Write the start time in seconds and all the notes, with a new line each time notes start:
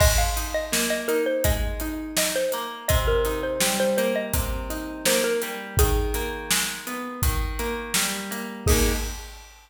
0.00 G#3 D#5, kick, crash
0.18 F5
0.36 D#4, closed hi-hat
0.54 D#5
0.72 A#3, snare
0.90 D#5
1.08 D#4 A#4, closed hi-hat
1.26 C5
1.44 G#3 D#5, kick, closed hi-hat
1.80 D#4, closed hi-hat
2.17 D#4 D#5, snare
2.36 C5
2.52 A#3, closed hi-hat
2.88 C3 D#5, kick, closed hi-hat
3.08 A#4
3.25 D#4, closed hi-hat
3.43 C5
3.61 G3, snare
3.80 C5
3.97 A#3 C5, closed hi-hat
4.16 D#5
4.34 C3, kick, closed hi-hat
4.70 D#4, closed hi-hat
5.05 A#3 C5, snare
5.24 A#4
5.42 G3, closed hi-hat
5.77 D#3 G#4, kick, closed hi-hat
6.14 A#3, closed hi-hat
6.51 G#3, snare
6.87 B3, closed hi-hat
7.22 D#3, kick, closed hi-hat
7.59 A#3, closed hi-hat
7.94 G3, snare
8.31 A#3, closed hi-hat
8.66 A#3 D#4 G#4, kick, crash
8.71 G#3